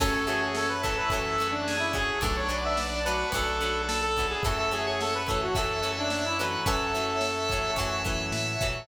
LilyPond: <<
  \new Staff \with { instrumentName = "Lead 1 (square)" } { \time 4/4 \key fis \minor \tempo 4 = 108 a'16 a'16 gis'16 gis'16 a'16 b'16 a'16 b'16 a'8. d'8 e'16 gis'8 | a'16 cis''16 d''16 e''16 d''8 b'8 a'4 a'16 a'8 gis'16 | a'16 a'16 gis'16 gis'16 a'16 b'16 a'16 fis'16 a'8. d'8 e'16 b'8 | a'2 r2 | }
  \new Staff \with { instrumentName = "Drawbar Organ" } { \time 4/4 \key fis \minor cis'4. e'4. gis'4 | d'4. fis'4. a'4 | e''16 e''8 cis''16 cis''8 r8 e''8 e''16 e''16 e''8 r8 | e''1 | }
  \new Staff \with { instrumentName = "Acoustic Guitar (steel)" } { \time 4/4 \key fis \minor <e fis a cis'>8 <e fis a cis'>4 <e fis a cis'>8 <e fis a cis'>8 <e fis a cis'>4 <e fis a cis'>8 | <fis a b d'>8 <fis a b d'>4 <fis a b d'>8 <fis a b d'>8 <fis a b d'>4 <fis a b d'>8 | <e fis a cis'>8 <e fis a cis'>4 <e fis a cis'>8 <e fis a cis'>8 <e fis a cis'>4 <e fis a cis'>8 | <e fis a cis'>8 <e fis a cis'>4 <e fis a cis'>8 <e fis a cis'>8 <e fis a cis'>4 <e fis a cis'>8 | }
  \new Staff \with { instrumentName = "Drawbar Organ" } { \time 4/4 \key fis \minor <cis'' e'' fis'' a''>2 <cis'' e'' fis'' a''>2 | <b' d'' fis'' a''>2 <b' d'' fis'' a''>2 | <cis'' e'' fis'' a''>4. <cis'' e'' fis'' a''>2~ <cis'' e'' fis'' a''>8 | <cis'' e'' fis'' a''>2 <cis'' e'' fis'' a''>2 | }
  \new Staff \with { instrumentName = "Synth Bass 1" } { \clef bass \time 4/4 \key fis \minor fis,2 fis,2 | b,,2 b,,2 | fis,2 fis,2 | fis,2 fis,4 a,8 ais,8 | }
  \new Staff \with { instrumentName = "Pad 5 (bowed)" } { \time 4/4 \key fis \minor <cis'' e'' fis'' a''>4 <cis'' e'' a'' cis'''>4 <cis'' e'' fis'' a''>4 <cis'' e'' a'' cis'''>4 | <b' d'' fis'' a''>4 <b' d'' a'' b''>4 <b' d'' fis'' a''>4 <b' d'' a'' b''>4 | <cis'' e'' fis'' a''>4 <cis'' e'' a'' cis'''>4 <cis'' e'' fis'' a''>4 <cis'' e'' a'' cis'''>4 | <cis'' e'' fis'' a''>4 <cis'' e'' a'' cis'''>4 <cis'' e'' fis'' a''>4 <cis'' e'' a'' cis'''>4 | }
  \new DrumStaff \with { instrumentName = "Drums" } \drummode { \time 4/4 <cymc bd>8 cymr8 sn8 <bd cymr>8 <bd cymr>8 cymr8 sn8 <bd cymr>8 | <bd cymr>8 cymr8 sn8 cymr8 <bd cymr>8 cymr8 sn8 <bd cymr>8 | <bd cymr>8 cymr8 sn8 <bd cymr>8 <bd cymr>8 cymr8 sn8 cymr8 | <bd cymr>8 cymr8 sn8 <bd cymr>8 <bd cymr>8 <bd cymr>8 sn8 <bd cymr>8 | }
>>